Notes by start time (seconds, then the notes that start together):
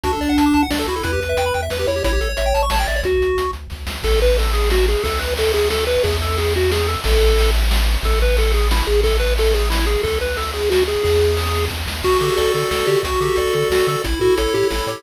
0.03 D2 D4 F#4, kick, closed hi-hat
0.13 A4
0.21 D2 D5, closed hi-hat
0.29 F#5
0.38 D2 A5, closed hi-hat
0.46 D6
0.53 D2 A5, closed hi-hat
0.63 F#5
0.70 D2 D4 D5, snare
0.79 A4
0.86 D2 E4 F#4, closed hi-hat
0.96 A4
1.03 E2 E4 B4, kick, closed hi-hat
1.13 G4
1.20 E2 B4, closed hi-hat
1.29 E5
1.37 E2 G5, closed hi-hat
1.46 B5
1.54 E2 G5, closed hi-hat
1.62 E5
1.70 E2 B4, snare
1.79 G4
1.87 E2 E4 C#5, closed hi-hat
1.96 G4
2.04 A1 E4 C#5, kick, closed hi-hat
2.13 G4
2.20 A1 A4, closed hi-hat
2.29 C#5
2.37 A1 E5, closed hi-hat
2.46 G5
2.54 A1 A5, closed hi-hat
2.63 C#6
2.70 A1 C#5 A5, snare
2.79 G5
2.87 A1 D5 E5, closed hi-hat
2.96 C#5
3.03 D2 F#4, kick, closed hi-hat
3.21 D2, closed hi-hat
3.37 D2, closed hi-hat
3.53 D2, closed hi-hat
3.70 D2, kick, snare
3.87 D2, snare
4.03 A1 A4, kick, crash
4.21 B4, ride
4.38 A4, ride
4.53 G#4, ride
4.70 F#4, snare
4.88 G#4, ride
5.04 D2 A4, kick, ride
5.19 B4, ride
5.37 A4, ride
5.54 G#4, ride
5.70 A4, snare
5.87 B4, ride
6.03 E2 G#4, kick, ride
6.21 A4, ride
6.37 G#4, ride
6.54 F#4, ride
6.72 G#4, snare
6.87 A4, ride
7.04 A1 A4, kick, ride
7.21 ride
7.39 ride
7.55 ride
7.71 snare
7.89 ride
8.03 A1 A4, kick, ride
8.21 B4, ride
8.37 A4, ride
8.53 G#4, ride
8.71 E4, snare
8.87 A1 G#4, ride
9.03 A4, kick, ride
9.20 B4, ride
9.38 A4, ride
9.54 G#4, ride
9.70 E4, snare
9.87 G#4, ride
10.03 D2 A4, kick, ride
10.21 B4, ride
10.37 A4, ride
10.54 G#4, ride
10.70 F#4, snare
10.88 G#4, ride
11.04 E2 G#4, kick, ride
11.22 ride
11.37 ride
11.54 ride
11.70 E2, kick, snare
11.87 D#2, snare
12.03 D2 F#4, kick, crash
12.12 closed hi-hat
12.21 D3 G4 A4, closed hi-hat
12.30 closed hi-hat
12.37 D2 A4 D5, closed hi-hat
12.45 closed hi-hat
12.54 D3 F#4 A4, closed hi-hat
12.62 closed hi-hat
12.71 D2 A4, snare
12.80 closed hi-hat
12.87 D3 G4 D5, closed hi-hat
12.96 closed hi-hat
13.03 D2 F#4, kick, closed hi-hat
13.13 closed hi-hat
13.20 D3 G4 A4, closed hi-hat
13.28 closed hi-hat
13.36 D2 A4 D5, closed hi-hat
13.47 closed hi-hat
13.53 D3 F#4 A4, closed hi-hat
13.62 closed hi-hat
13.70 D2 F#4 A4, snare
13.80 closed hi-hat
13.87 D3 A4 D5, closed hi-hat
13.96 closed hi-hat
14.04 A1 E4, kick, closed hi-hat
14.13 closed hi-hat
14.20 A2 F#4 A4, closed hi-hat
14.30 closed hi-hat
14.37 A1 A4 C#5, closed hi-hat
14.47 closed hi-hat
14.53 A2 E4 G4, closed hi-hat
14.63 closed hi-hat
14.70 A1 E4 A4, snare
14.80 closed hi-hat
14.87 A2 G4 C#5, closed hi-hat
14.96 open hi-hat